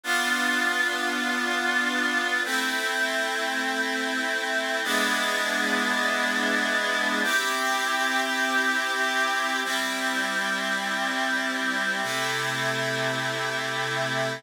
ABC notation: X:1
M:4/4
L:1/8
Q:1/4=50
K:Am
V:1 name="Clarinet"
[B,DF]4 [A,CE]4 | [^G,B,DE]4 [CE=G]4 | [G,CE]4 [C,A,E]4 |]